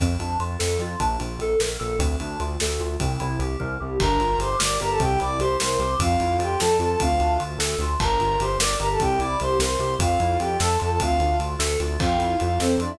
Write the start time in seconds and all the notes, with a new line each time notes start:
0.00 F2 C4, kick, ride
0.19 F2 D4, ride
0.40 F2 F4, ride
0.59 F2 A4, snare
0.79 F2 F4, ride
1.00 A#1 D4, kick, ride
1.19 A#1 F4, ride
1.38 A#1 A4, ride
1.60 A#1 A#4, snare
1.79 A#1 A4, ride
1.99 D2 C4, kick, ride
2.20 D2 D4, ride
2.40 D2 F4, ride
2.60 D2 A4, snare
2.80 D2 F4, ride
3.00 C2 C4, kick, ride
3.20 C2 E4, ride
3.39 C2 G4, ride
3.60 C2 A#4, kick
3.80 C2 G4
3.99 G1 D4 A#4 A#5, kick, crash
4.19 G1 F4, ride
4.38 G1 G4 C5 C6, ride
4.59 G1 A#4 D5 D6, snare
4.80 G1 G4 A#4 A#5, ride
4.91 A4 A5
5.00 C2 C4 G4 G5, kick, ride
5.19 C2 E4 D5 D6, ride
5.39 C2 G4 C5 C6, ride
5.60 C2 A#4 C5 C6, snare
5.79 C2 G4, ride
6.00 F2 C4 F4 F5, kick, ride
6.20 F2 E4, ride
6.39 F2 F4 G4 G5, ride
6.59 F2 A4 A5, snare
6.79 F2 F4 A4 A5, ride
6.90 A4 A5
7.00 D2 C4 F4 F5, kick, ride
7.20 D2 D4, ride
7.40 D2 F4, ride
7.58 D2 A4, snare
7.79 D2 F4, ride
8.00 G1 D4 A#4 A#5, kick, crash
8.20 G1 F4, ride
8.40 G1 G4 C5 C6, ride
8.59 G1 A#4 D5 D6, snare
8.79 G1 G4 A#4 A#5, ride
8.91 A4 A5
8.99 C2 C4 G4 G5, kick, ride
9.19 C2 E4 D5 D6, ride
9.40 C2 G4 C5 C6, ride
9.60 C2 A#4 C5 C6, snare
9.79 C2 G4, ride
9.99 F2 C4 F4 F5, kick, ride
10.20 F2 E4, ride
10.39 F2 F4 G4 G5, ride
10.60 F2 A4 A5, snare
10.79 F2 F4 A4 A5, ride
10.90 A4 A5
11.00 D2 C4 F4 F5, kick, ride
11.20 D2 D4, ride
11.39 D2 F4, ride
11.59 D2 A4, snare
11.80 D2 F4, ride
12.00 F2 C4 F4 F5, kick, crash
12.18 F2 E4, ride
12.40 F2 F4 F5, ride
12.60 F2 C4 A4 C5, snare
12.78 F2 D4 F4 D5, ride
12.89 E4 E5